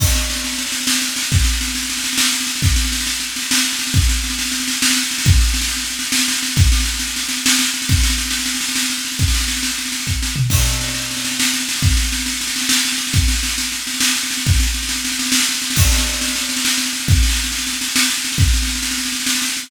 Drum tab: CC |x-----------------|------------------|------------------|------------------|
SD |oooooooooooooooooo|oooooooooooooooooo|oooooooooooooooooo|oooooooooooooooooo|
FT |------------------|------------------|------------------|------------------|
BD |o-----------------|o-----------------|o-----------------|o-----------------|

CC |------------------|------------------|------------------|------------------|
SD |oooooooooooooooooo|oooooooooooooooooo|oooooooooooooooooo|ooooooooooooo-o---|
FT |------------------|------------------|------------------|----------------o-|
BD |o-----------------|o-----------------|o-----------------|o-----------o-----|

CC |x-----------------|------------------|------------------|------------------|
SD |oooooooooooooooooo|oooooooooooooooooo|oooooooooooooooooo|oooooooooooooooooo|
FT |------------------|------------------|------------------|------------------|
BD |o-----------------|o-----------------|o-----------------|o-----------------|

CC |x-----------------|------------------|------------------|
SD |oooooooooooooooooo|oooooooooooooooooo|oooooooooooooooooo|
FT |------------------|------------------|------------------|
BD |o-----------------|o-----------------|o-----------------|